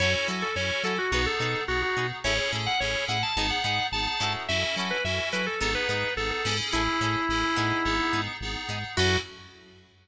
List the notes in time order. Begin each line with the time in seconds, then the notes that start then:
0.00 F#2 C#4 E4 F#4 A4 C#5
0.14 C#5
0.28 F#3 E4 F#4 A4 C#5
0.42 A4
0.56 F#2 C#4 E4 F#4 A4 C#5
0.83 F#3 E4 F#4 A4 C#5
0.98 F#4
1.12 B1 B3 D#4 F#4 G#4 B4
1.26 A4
1.40 B2 D#4 G#4 A4 B4
1.68 B1 B3 D#4 F#4 G#4
1.82 F#4
1.97 B2 D#4 G#4 B4
2.24 A1 C#4 E4 G#4 A4 C#5
2.38 C#5
2.52 A2 C#4 E4 G#4 A4
2.66 F#5
2.80 A1 C#4 E4 G#4 A4 C#5
3.08 A2 C#4 E4 G#4 A4 F#5
3.23 A5
3.36 G#1 B3 D#4 G#4 A5
3.50 F#5
3.64 G#2 B3 D#4 G#4 F#5
3.92 G#1 B3 D#4 G#4 A5
4.07 A5
4.20 G#2 C#4 E4 F#4 A4
4.48 F#2 C#4 E4 F#4 A4 E5
4.63 E5
4.76 F#3 C#4 E4 F#4 A4
4.91 B4
5.04 F#2 C#4 E4 F#4 A4 E5
5.32 F#3 C#4 E4 F#4 A4 B4
5.46 A4
5.61 G#1 B3 D#4 G#4 A4
5.75 B4
5.89 G#2 B3 D#4 G#4 B4
6.17 G#1 B3 D#4 G#4 A4
6.31 A4
6.45 G#2 B3 C#4 D#4 E4 G#4 A4
6.72 A1 C#4 E4 G#4 A4
7.01 A2 C#4 E4 G#4 A4
7.29 A1 C#4 E4 G#4 A4
7.56 A2 B3 D#4 G#4
7.85 G#1 B3 D#4 G#4
8.13 G#2 B3 D#4 G#4
8.41 G#1 B3 D#4 G#4
8.69 G#2 B3 D#4 G#4
8.97 F#2 C#4 E4 F#4 A4 C#5